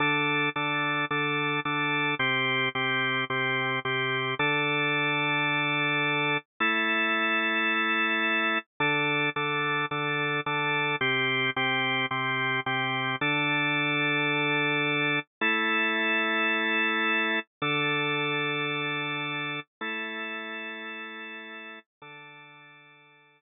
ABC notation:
X:1
M:4/4
L:1/8
Q:1/4=109
K:Dm
V:1 name="Drawbar Organ"
[D,DA]2 [D,DA]2 [D,DA]2 [D,DA]2 | [C,CG]2 [C,CG]2 [C,CG]2 [C,CG]2 | [D,DA]8 | [A,EA]8 |
[D,DA]2 [D,DA]2 [D,DA]2 [D,DA]2 | [C,CG]2 [C,CG]2 [C,CG]2 [C,CG]2 | [D,DA]8 | [A,EA]8 |
[D,DA]8 | [A,EA]8 | [D,DA]8 |]